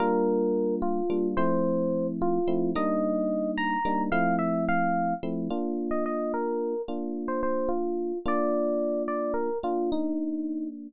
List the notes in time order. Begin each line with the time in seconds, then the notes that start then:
0.00 G3 A#3 D4 F4 A#4
0.82 F4
1.10 G3 A#3 D4 F4
1.37 F3 A3 C4 E4 C5
2.22 F4
2.48 F3 A3 C4 E4
2.75 G3 A#3 D4 D#4 D#5
3.58 A#5
3.85 G3 A#3 D4 D#4
4.12 F3 A3 C4 E4 F5
4.39 E5
4.69 F5
5.23 F3 A3 C4 E4
5.50 A#3 D4 F4
5.91 D#5
6.06 D#5
6.34 A#4
6.88 A#3 D4 F4
7.28 C5
7.43 C5
7.69 F4
8.26 A#3 D4 F4 D5
9.08 D5
9.34 A#4
9.63 A#3 D4 F4
9.92 D#4